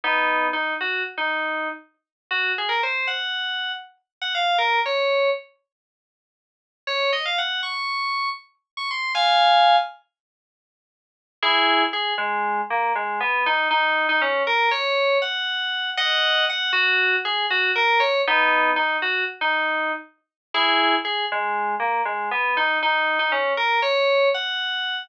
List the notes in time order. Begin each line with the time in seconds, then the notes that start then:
0.04 B3 D#4
0.53 D#4
0.81 F#4
1.18 D#4
2.31 F#4
2.58 G#4
2.69 A#4
2.83 C5
3.07 F#5
4.22 F#5
4.35 F5
4.58 A#4
4.86 C#5
6.87 C#5
7.13 D#5
7.25 F5
7.38 F#5
7.63 C#6
8.77 C#6
8.91 C6
9.15 F5 G#5
11.43 E4 G#4
11.93 G#4
12.18 G#3
12.70 A#3
12.95 G#3
13.20 B3
13.46 D#4
13.71 D#4
14.09 D#4
14.22 C#4
14.47 A#4
14.71 C#5
15.22 F#5
15.97 D#5 F#5
16.49 F#5
16.73 F#4
17.25 G#4
17.50 F#4
17.76 A#4
18.00 C#5
18.27 B3 D#4
18.76 D#4
19.02 F#4
19.41 D#4
20.54 E4 G#4
21.05 G#4
21.32 G#3
21.80 A#3
22.05 G#3
22.31 B3
22.57 D#4
22.83 D#4
23.19 D#4
23.32 C#4
23.57 A#4
23.82 C#5
24.34 F#5